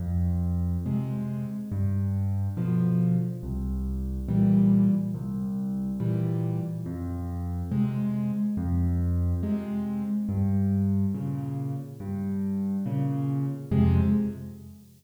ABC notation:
X:1
M:6/8
L:1/8
Q:3/8=70
K:Fm
V:1 name="Acoustic Grand Piano" clef=bass
F,,3 [C,A,]3 | G,,3 [=B,,=D,F,]3 | C,,3 [B,,=E,G,]3 | C,,3 [B,,=E,G,]3 |
F,,3 [C,A,]3 | F,,3 [C,A,]3 | G,,3 [B,,D,]3 | G,,3 [B,,D,]3 |
[F,,C,A,]3 z3 |]